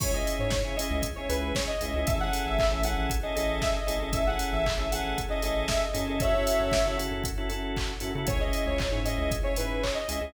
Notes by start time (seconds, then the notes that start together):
0.00 C#2 C#4 E4 G#4 C#5, kick, crash
0.13 C#4 E4 G#4 D#5
0.27 open hi-hat
0.39 G#2 C#5
0.50 C#5, kick, snare
0.64 C#3 C#4 E4 G#4
0.76 C#4 E4 G#4 D#5, open hi-hat
0.91 C#2
1.02 kick, closed hi-hat
1.16 C#4 E4 G#4 C#5
1.29 C#2 C#4 E4 G#4 B4, open hi-hat
1.55 C#5, kick, snare
1.67 D#5
1.81 C#2 C#4 E4 G#4, open hi-hat
1.94 C#2 C#4 E4 G#4
2.07 A1 C#4 E4 G#4 A4 E5, kick, closed hi-hat
2.20 C#4 E4 G#4 A4 F#5
2.33 open hi-hat
2.46 A1 E5
2.59 E5, kick, clap
2.71 A1 C#4 E4 G#4 A4
2.83 C#4 E4 G#4 A4 F#5, open hi-hat
2.98 A1
3.10 kick, closed hi-hat
3.23 C#4 E4 G#4 A4 D#5
3.35 A1 C#4 E4 G#4 A4 D#5, open hi-hat
3.62 E5, kick, snare
3.76 D#5
3.87 A1 C#4 E4 G#4 A4, open hi-hat
4.00 A1 C#4 E4 G#4 A4
4.12 A1 C#4 E4 G#4 A4 E5, kick, closed hi-hat
4.27 C#4 E4 G#4 A4 F#5
4.39 open hi-hat
4.52 A1 E5
4.66 E5, kick, clap
4.78 A1 C#4 E4 G#4 A4
4.91 C#4 E4 G#4 A4 F#5, open hi-hat
5.04 A1
5.18 kick, closed hi-hat
5.29 C#4 E4 G#4 A4 D#5
5.42 A1 C#4 E4 G#4 A4 D#5, open hi-hat
5.68 E5, kick, snare
5.83 D#5
5.93 F#2 C#4 E4 G#4 A4, open hi-hat
6.07 C#4 E4 G#4 A4
6.20 C#4 E4 F#4 A4 C#5 E5, kick, closed hi-hat
6.35 C#4 E4 F#4 A4
6.47 open hi-hat
6.60 F#2
6.71 kick, snare
6.85 C#3 C#4 E4 F#4 A4
6.97 C#4 E4 F#4 A4, open hi-hat
7.11 F#2
7.24 kick, closed hi-hat
7.37 C#4 E4 F#4 A4
7.49 F#2 C#4 E4 F#4 A4, open hi-hat
7.77 kick, clap
8.00 F#2 C#4 E4 F#4 A4, open hi-hat
8.15 C#3 C#4 E4 F#4 A4
8.27 C#2 C#4 E4 G#4 C#5, kick, closed hi-hat
8.40 C#4 E4 G#4 D#5
8.53 open hi-hat
8.66 C#2 C#5
8.78 C#5, kick, clap
8.91 G#2 C#4 E4 G#4
9.05 C#4 E4 G#4 D#5, open hi-hat
9.18 C#2
9.31 kick, closed hi-hat
9.43 C#4 E4 G#4 C#5
9.56 G#2 C#4 E4 G#4 B4, open hi-hat
9.83 C#5, kick, clap
9.95 D#5
10.08 C#2 C#4 E4 G#4, open hi-hat
10.21 C#2 C#4 E4 G#4